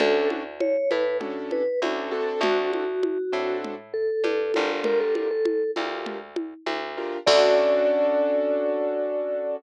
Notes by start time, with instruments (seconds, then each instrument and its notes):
0.00 electric bass (finger) D2, acoustic grand piano C#4 D4 F#4 A4, vibraphone A4, low conga
0.30 high conga
0.60 vibraphone C#5, high conga
0.91 electric bass (finger) A2, vibraphone B4, high conga
1.20 acoustic grand piano C#4 D4 F#4 A4, low conga
1.51 vibraphone B4, high conga
1.82 electric bass (finger) D2, acoustic grand piano C#4 D4 F#4 A4, high conga
2.11 acoustic grand piano C4 D4 F#4 A4, vibraphone A4
2.41 electric bass (finger) D2, vibraphone F#4, low conga
2.73 vibraphone F#4, high conga
3.03 high conga
3.32 electric bass (finger) A2, acoustic grand piano C4 D4 F#4 A4
3.64 low conga
3.94 vibraphone A4
4.24 electric bass (finger) G2, high conga
4.54 electric bass (finger) G1, acoustic grand piano D4 F4 G4 A#4, high conga
4.84 vibraphone A#4, low conga
5.00 vibraphone A4
5.15 vibraphone A4, high conga
5.31 vibraphone A4
5.45 high conga
5.76 electric bass (finger) D2, acoustic grand piano D4 F4 G4 A#4, high conga
6.06 low conga
6.36 high conga
6.66 electric bass (finger) D2, high conga
6.97 acoustic grand piano D4 F4 G4 A#4
7.27 electric bass (finger) D2, acoustic grand piano C#4 D4 F#4 A4, vibraphone D5, kick, crash